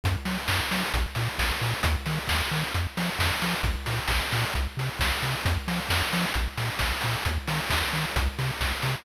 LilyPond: <<
  \new Staff \with { instrumentName = "Synth Bass 1" } { \clef bass \time 4/4 \key bes \minor \tempo 4 = 133 ges,8 ges8 ges,8 ges8 bes,,8 bes,8 bes,,8 bes,8 | ees,8 ees8 ees,8 ees8 f,8 f8 f,8 f8 | bes,,8 bes,8 bes,,8 bes,8 c,8 c8 c,8 c8 | f,8 f8 f,8 f8 bes,,8 bes,8 bes,,8 bes,8 |
ees,8 ees8 ees,8 ees8 c,8 c8 c,8 c8 | }
  \new DrumStaff \with { instrumentName = "Drums" } \drummode { \time 4/4 <hh bd>8 hho8 <bd sn>8 hho8 <hh bd>8 hho8 <bd sn>8 hho8 | <hh bd>8 hho8 <bd sn>8 hho8 <hh bd>8 hho8 <bd sn>8 hho8 | <hh bd>8 hho8 <bd sn>8 hho8 <hh bd>8 hho8 <bd sn>8 hho8 | <hh bd>8 hho8 <bd sn>8 hho8 <hh bd>8 hho8 <bd sn>8 hho8 |
<hh bd>8 hho8 <bd sn>8 hho8 <hh bd>8 hho8 <bd sn>8 hho8 | }
>>